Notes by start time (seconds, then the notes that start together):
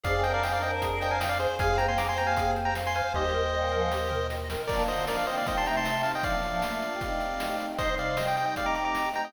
0.03 F2 D#4 G#4 C5 D5 F5 G#5, kick, closed hi-hat
0.14 C4 G#4
0.23 D4 A#4 C5 D#5 G5, closed hi-hat
0.34 D5 F5
0.42 C4 G#4 D#5 F5 G5, snare
0.53 D4 A#4 D5 F5
0.62 D4 A#4 C5 D#5 G5, closed hi-hat
0.82 G#4, kick, closed hi-hat
1.01 C5 D#5 G5, closed hi-hat
1.11 F5 G#5
1.20 D#5 F5 G5, snare
1.29 D5 F5
1.39 G#4 C5, closed hi-hat
1.59 F2 G#3 F4 G#4 C5 F5 G#5, kick, closed hi-hat
1.70 C4 G#4
1.77 A#3 G4 C5 G5 A#5, closed hi-hat
1.88 G#5 C6
1.97 C4 G#4 F5 A#5 D6, snare
2.08 A#3 G4 G#5 C6
2.16 A#3 G4 C5 G5 A#5, closed hi-hat
2.27 F5 G#5
2.37 G#4, kick, closed hi-hat
2.56 C5, closed hi-hat
2.65 G5 A#5
2.75 F5, snare
2.87 G#5 C6
2.95 C5 F5 G#5, closed hi-hat
3.14 D#2 G3 D#4 G4 A#4 C5 D#5 G5, kick
3.25 G3 D#4
3.34 A#4
3.53 A#2 G3 D#5
3.71 G#2 F3 A#4
3.92 G4, snare
4.09 A#4, floor tom
4.30 D#5, snare
4.50 A#4, snare
4.67 F3 A#3 D4 F4 A#4 D5, kick, crash
4.88 D3 A#3 C5 D#5, closed hi-hat
5.07 F3 D4 A#4 D5, snare
5.17 D5 F5
5.27 D#3 C4 C5 D#5, closed hi-hat
5.37 D5 F5
5.46 A#2 G3 C4 D#4 G4 C5 D#5, kick, closed hi-hat
5.57 A5 C6
5.65 C3 A3 G5 A#5, closed hi-hat
5.77 A5 C6
5.85 snare
6.03 F5 A5, open hi-hat
6.15 D#5 G5
6.23 A2 F3 A#3 D4 F4 D5 F5, kick, closed hi-hat
6.35 A2 F3
6.43 A2 F3, closed hi-hat
6.62 A3 F4, snare
6.82 closed hi-hat
6.92 A#3 G4
7.00 A3 C4 D#4 G4 D#5, kick, closed hi-hat
7.20 closed hi-hat
7.40 snare
7.59 G4 D#5, closed hi-hat
7.69 G4 D#5
7.78 C3 G3 D#4 C5 D#5, kick, closed hi-hat
7.89 D#4 C5
7.98 D#4 C5 D5 F5, closed hi-hat
8.17 G4 C5 D#5, snare
8.27 D#5 G5
8.36 D#5 G5, closed hi-hat
8.46 G4 D#5 G5
8.56 A3 C4 D#4 G4 D5 D#5 F5, kick, closed hi-hat
8.66 A#5 D6
8.75 A#5 D6, closed hi-hat
8.85 A#5 D6
8.95 snare
9.14 G4 D#5 G5 A#5, closed hi-hat
9.25 G4 D#5 G5